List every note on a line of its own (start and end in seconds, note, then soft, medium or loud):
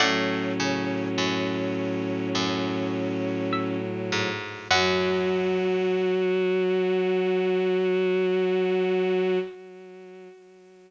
0.00 0.53 A2 medium
0.00 4.29 A2 medium
0.00 4.29 F#3 medium
0.00 3.78 C#4 medium
0.00 3.02 D5 medium
0.00 3.02 F#5 medium
0.60 1.08 C#3 medium
1.18 2.29 F#2 medium
2.35 4.03 F#2 medium
3.53 4.67 E5 medium
4.12 4.68 G#2 medium
4.70 9.38 F#2 loud
4.70 9.38 F#3 loud
4.70 9.39 F#4 loud
4.70 9.39 F#5 loud